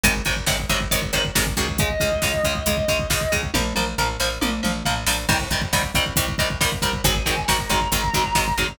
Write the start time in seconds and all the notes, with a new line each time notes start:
0.03 G#1 C3 D#3 F#3 G#3, kick, closed hi-hat
0.16 kick
0.25 G#1 C3 D#3 F#3 G#3, kick, closed hi-hat
0.37 kick
0.47 G#1 C3 D#3 F#3 G#3, kick, snare
0.60 kick
0.69 G#1 C3 D#3 F#3 G#3, kick, closed hi-hat
0.81 kick
0.91 G#1 C3 D#3 F#3 G#3, kick, closed hi-hat
1.02 kick
1.13 G#1 C3 D#3 F#3 G#3, kick, closed hi-hat
1.25 kick
1.35 G#1 C3 D#3 F#3 G#3, kick, snare
1.47 kick
1.57 C#2 C3 D#3 F#3 G#3, kick, closed hi-hat
1.68 kick
1.78 C#3 G#3 D#5, kick, closed hi-hat
1.90 kick
2.00 C#2 C#3 G#3, kick, closed hi-hat
2.12 kick
2.22 C#2 C#3 G#3, kick, snare
2.34 kick
2.44 C#2 C#3 G#3, kick, closed hi-hat
2.55 kick
2.66 C#2 C#3 G#3, kick, closed hi-hat
2.77 kick
2.88 C#2 C#3 G#3, kick, closed hi-hat
2.99 kick
3.10 C#2 C#3 G#3, kick, snare
3.21 kick
3.32 C#2 C#3 G#3, kick, closed hi-hat
3.43 kick
3.54 A#1 F3 A#3, kick, high tom
3.75 A#1 F3 A#3, mid tom
3.98 A#1 F3 A#3, floor tom
4.20 A#1 F3 A#3, snare
4.41 A#1 F3 A#3, high tom
4.63 A#1 F3 A#3, mid tom
4.85 A#1 F3 A#3, floor tom
5.06 A#1 F3 A#3, snare
5.29 C2 D#3 G3 C4, kick, crash
5.40 kick
5.50 C2 D#3 G3 C4, kick, closed hi-hat
5.62 kick
5.73 C2 D#3 G3 C4, kick, snare
5.83 kick
5.94 C2 D#3 G3 C4, kick, closed hi-hat
6.06 kick
6.16 C2 D#3 G3 C4, kick, closed hi-hat
6.28 kick
6.38 C2 D#3 G3 C4, kick, closed hi-hat
6.50 kick
6.61 C2 D#3 G3 C4, kick, snare
6.72 kick
6.82 C2 D#3 G3 C4, kick, closed hi-hat
6.93 kick
7.04 G#1 D#3 F#3 G#3 C4 G#5, kick, closed hi-hat
7.15 kick
7.26 G#1 D#3 F#3 G#3 C4, kick, closed hi-hat
7.38 kick
7.48 G#1 D#3 F#3 G#3 C4 A#5, kick, snare
7.59 kick
7.69 G#1 D#3 F#3 G#3 C4, kick, closed hi-hat
7.81 kick
7.92 G#1 D#3 F#3 G#3 C4, kick, closed hi-hat
8.04 kick
8.14 G#1 D#3 F#3 G#3 C4, kick, closed hi-hat
8.24 kick
8.35 G#1 D#3 F#3 G#3 C4, kick, snare
8.48 kick
8.57 G#1 D#3 F#3 G#3 C4, kick, closed hi-hat
8.68 kick